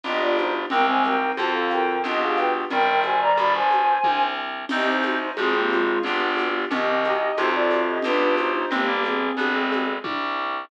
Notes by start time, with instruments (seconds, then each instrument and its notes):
0.03 harpsichord G1, electric piano 2 B3 D4 F4 G4, flute G4 D#5, low conga, shaker
0.21 flute F4 D5
0.37 flute D#4 C5, high conga, shaker
0.70 harpsichord C2, clarinet G#3 C4, electric piano 2 C4, flute A#4 G5, low conga, shaker
0.88 flute C5 G#5
1.03 electric piano 2 D#4, flute A#4 G5, high conga, shaker
1.37 harpsichord F2, clarinet D3 F3, electric piano 2 C4 F4 A4, flute C5 A5, high conga, shaker
1.54 flute A4 F5
1.70 flute A#4 G5, high conga, shaker
2.04 harpsichord B1, electric piano 2 B3 D4 F4 G4, flute G4 D#5, low conga, shaker
2.21 flute G#4 F5
2.36 flute B4 G5, high conga, shaker
2.70 harpsichord G1, clarinet D#3 G3, flute A#4 G5, low conga, shaker
3.02 flute C5 G#5, high conga, shaker
3.21 flute D5 A#5
3.37 harpsichord G1, flute D5 B5, high conga, shaker
3.54 flute C5 G#5
3.71 high conga, shaker
4.04 harpsichord C2, kick, high tom
4.69 harpsichord C2, electric piano 2 C4, clarinet C4 D#4, flute G4 D#5, crash, low conga, shaker
4.87 flute D#4 C5
5.02 electric piano 2 D#4, high conga, shaker
5.37 harpsichord G#1, clarinet F3 G#3, flute C4 G#4, electric piano 2 C4 F4 G#4, high conga, shaker
5.54 flute A#3 G4
5.70 flute G#3 F4, high conga, shaker
6.03 harpsichord G1, flute B3 G4, electric piano 2 B3 D4 F4 G4, low conga, shaker
6.37 high conga, shaker
6.70 harpsichord C2, clarinet C3 D#3, electric piano 2 C4, flute G4 D#5, low conga, shaker
7.04 electric piano 2 D#4, high conga, shaker
7.37 harpsichord F2, clarinet A2 C3, electric piano 2 C4 F4 A4, flute D#4 C5, high conga, shaker
7.54 flute F4 D5
7.70 high conga, shaker
7.87 flute G4 D#5
8.02 harpsichord B1, electric piano 2 B3 D4 F4 G4, flute D4 B4, low conga, shaker
8.37 flute D#4 C5, high conga, shaker
8.54 flute D#4 C5
8.71 harpsichord G1, clarinet G#3 C4, flute A#3 G4, low conga, shaker
8.88 clarinet G3 A#3
9.04 flute C4 G#4, high conga, shaker
9.37 harpsichord G1, clarinet B3 D4, high conga, shaker
9.54 clarinet G#3 C4
9.72 high conga, shaker
10.04 harpsichord C2, kick, high tom